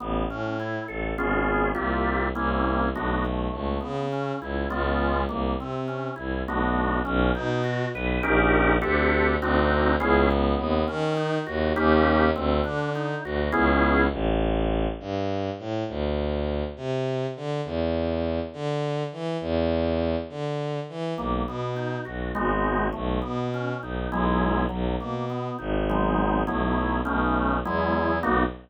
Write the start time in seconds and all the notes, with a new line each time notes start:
0.00 A1 B3
0.29 A2 C#4
0.60 E4
0.88 A1 A4
1.17 G#1 B3 C#4 F4 G#4
1.75 C2 A#3 C4 F4 G4
2.35 C2 A#3 C4 C#4 E4
2.94 B1 A3 B3 D4 F#4
3.25 A3
3.53 C#2
3.81 C#3 B3
4.12 C#4
4.41 C#2 E4
4.70 C#2 G#3 B3 C#4 F4
5.29 C2 A#3
5.59 C3 C4
5.88 C#4
6.16 C2 E4
6.47 B1 A3 B3 D4 F#4
7.05 B1 C#4
7.35 B2 D#4
7.64 F#4
7.93 B1 B4
8.23 A#1 C#4 D#4 G4 A#4
8.82 D2 C4 D4 G4 A4
9.41 D2 C4 D4 D#4 F#4
10.00 C#2 B3 C#4 E4 G#4
10.31 B3
10.59 D#2
10.88 D#3 C#4
11.17 D#4
11.47 D#2 F#4
11.76 D#2 A#3 C#4 D#4 G4
12.36 D2 C4
12.64 D3 D4
12.95 D#4
13.24 D2 F#4
13.52 C#2 B3 C#4 E4 G#4
14.12 A1
15.00 G2
15.59 A2
15.88 D2
16.76 C3
17.36 D3
17.65 E2
18.53 D3
19.12 E3
19.41 E2
20.29 D3
20.89 E3
21.17 B1 A#3
21.47 B2 B3
21.76 D#4
22.05 B1 F#4
22.35 G#1 G#3 B3 D#4 F#4
22.93 B1 A3
23.22 B2 B3
23.54 C#4
23.82 B1 D#4
24.12 B1 F#3 G#3 B3 E4
24.69 B1 F#3
25.00 B2 A#3
25.30 B3
25.59 G#1 D#4
25.90 F#3 G#3 B3 D#4
26.47 B1 F#3 A3 B3 E4
27.05 B1 A3 B3 C#4 D#4
27.65 E2 F#3 G#3 B3 E4
28.23 B1 A#3 B3 D#4 F#4